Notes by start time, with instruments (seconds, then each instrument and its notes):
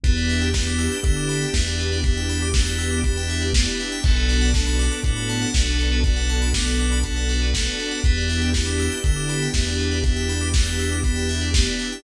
0.04 synth bass 1 E2, electric piano 2 B3 D4 E4 G4, string ensemble 1 B3 D4 E4 G4, tubular bells B4, kick, closed hi-hat
0.17 tubular bells D5
0.29 tubular bells E5, open hi-hat
0.41 tubular bells G5
0.54 electric piano 2 B3 D4 E4 G4, tubular bells B5, kick, snare
0.67 tubular bells D6
0.79 tubular bells E6, open hi-hat
0.92 tubular bells G6
1.03 synth bass 1 D3, electric piano 2 B3 D4 E4 G4, tubular bells E6, kick, closed hi-hat
1.16 tubular bells D6
1.29 tubular bells B5, open hi-hat
1.42 tubular bells G5
1.54 synth bass 1 E2, electric piano 2 B3 D4 E4 G4, tubular bells E5, kick, snare
1.67 tubular bells D5
1.79 tubular bells B4, open hi-hat
1.92 tubular bells D5
2.04 electric piano 2 B3 D4 E4 G4, tubular bells E5, kick, closed hi-hat
2.17 tubular bells G5
2.29 tubular bells B5, open hi-hat
2.42 tubular bells D6
2.54 electric piano 2 B3 D4 E4 G4, tubular bells E6, kick, snare
2.67 tubular bells G6
2.78 tubular bells E6, open hi-hat
2.91 tubular bells D6
3.04 electric piano 2 B3 D4 E4 G4, tubular bells B5, kick, closed hi-hat
3.17 tubular bells G5
3.29 tubular bells E5, open hi-hat
3.41 tubular bells D5
3.54 electric piano 2 B3 D4 E4 G4, tubular bells B4, kick, snare
3.67 tubular bells D5
3.79 tubular bells E5, open hi-hat
3.92 tubular bells G5
4.04 synth bass 1 B1, string ensemble 1 B3 D4 F#4 A4, electric piano 2 B3 D4 F#4 A4, tubular bells A4, kick, crash
4.16 tubular bells B4
4.29 tubular bells D5, open hi-hat
4.41 tubular bells F#5
4.54 electric piano 2 B3 D4 F#4 A4, tubular bells A5, kick, snare
4.66 tubular bells B5
4.79 tubular bells D6, open hi-hat
4.92 tubular bells F#6
5.03 synth bass 1 A2, electric piano 2 B3 D4 F#4 A4, tubular bells D6, kick, closed hi-hat
5.16 tubular bells B5
5.29 tubular bells A5, open hi-hat
5.42 tubular bells F#5
5.54 synth bass 1 B1, electric piano 2 B3 D4 F#4 A4, tubular bells D5, kick, snare
5.67 tubular bells B4
5.79 tubular bells A4, open hi-hat
5.92 tubular bells B4
6.04 electric piano 2 B3 D4 F#4 A4, tubular bells D5, kick, closed hi-hat
6.16 tubular bells F#5
6.29 tubular bells A5, open hi-hat
6.42 tubular bells B5
6.54 electric piano 2 B3 D4 F#4 A4, tubular bells D6, kick, snare
6.67 tubular bells F#6
6.79 tubular bells D6, open hi-hat
6.92 tubular bells B5
7.03 electric piano 2 B3 D4 F#4 A4, tubular bells A5, kick, closed hi-hat
7.16 tubular bells F#5
7.29 tubular bells D5, open hi-hat
7.42 tubular bells B4
7.54 electric piano 2 B3 D4 F#4 A4, tubular bells A4, kick, snare
7.66 tubular bells B4
7.79 tubular bells D5, open hi-hat
7.91 tubular bells F#5
8.04 synth bass 1 E2, electric piano 2 B3 D4 E4 G4, string ensemble 1 B3 D4 E4 G4, tubular bells B4, kick, closed hi-hat
8.17 tubular bells D5
8.29 tubular bells E5, open hi-hat
8.42 tubular bells G5
8.54 electric piano 2 B3 D4 E4 G4, tubular bells B5, kick, snare
8.66 tubular bells D6
8.79 tubular bells E6, open hi-hat
8.92 tubular bells G6
9.04 synth bass 1 D3, electric piano 2 B3 D4 E4 G4, tubular bells E6, kick, closed hi-hat
9.16 tubular bells D6
9.29 tubular bells B5, open hi-hat
9.42 tubular bells G5
9.54 synth bass 1 E2, electric piano 2 B3 D4 E4 G4, tubular bells E5, kick, snare
9.66 tubular bells D5
9.78 tubular bells B4, open hi-hat
9.91 tubular bells D5
10.04 electric piano 2 B3 D4 E4 G4, tubular bells E5, kick, closed hi-hat
10.16 tubular bells G5
10.29 tubular bells B5, open hi-hat
10.41 tubular bells D6
10.54 electric piano 2 B3 D4 E4 G4, tubular bells E6, kick, snare
10.66 tubular bells G6
10.79 tubular bells E6, open hi-hat
10.92 tubular bells D6
11.04 electric piano 2 B3 D4 E4 G4, tubular bells B5, kick, closed hi-hat
11.16 tubular bells G5
11.29 tubular bells E5, open hi-hat
11.41 tubular bells D5
11.54 electric piano 2 B3 D4 E4 G4, tubular bells B4, kick, snare
11.66 tubular bells D5
11.79 tubular bells E5, open hi-hat
11.92 tubular bells G5